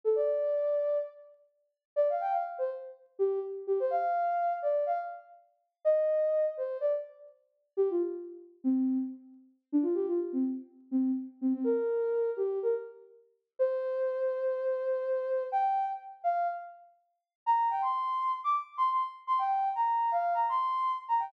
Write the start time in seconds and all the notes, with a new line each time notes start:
0.04 A4
0.16 D5
1.96 D5
2.10 F5
2.21 G5
2.32 F5
2.58 C5
3.19 G4
3.67 G4
3.80 C5
3.91 F5
4.62 D5
4.86 F5
5.85 D#5
6.57 C5
6.81 D5
7.77 G4
7.90 F4
8.64 C4
9.72 D4
9.83 F4
9.94 G4
10.08 F4
10.33 C4
10.91 C4
11.41 C4
11.54 C4
11.64 A#4
12.37 G4
12.63 A#4
13.59 C5
15.52 G5
16.24 F5
17.46 A#5
17.70 G5
17.82 C6
18.44 D6
18.78 C6
18.91 C6
19.27 C6
19.39 G5
19.75 A#5
20.12 F5
20.34 A#5
20.49 C6
21.08 A#5
21.19 G5